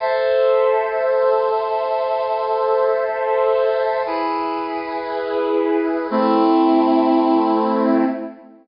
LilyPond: \new Staff { \time 4/4 \key a \minor \tempo 4 = 118 <a' c'' e''>1~ | <a' c'' e''>1 | <e' gis' b'>1 | <a c' e'>1 | }